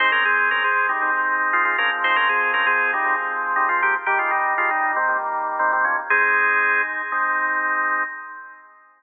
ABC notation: X:1
M:4/4
L:1/16
Q:1/4=118
K:Ab
V:1 name="Drawbar Organ"
[Ec] [DB] [CA]2 [DB] [CA]2 [G,E]2 z3 [A,F] [A,F] [DB] z | [Ec] [DB] [CA]2 [DB] [CA]2 [G,E]2 z3 [G,E] [A,F] [B,G] z | [B,G] [A,F] [G,E]2 [A,F] [G,E]2 [E,C]2 z3 [E,C] [E,C] [F,D] z | [CA]6 z10 |]
V:2 name="Drawbar Organ"
[A,C]8 [A,CE]6 [F,A,C]2- | [F,A,C]8 [F,A,C]8 | [E,G,]8 [E,G,B,]8 | [A,E]8 [A,CE]8 |]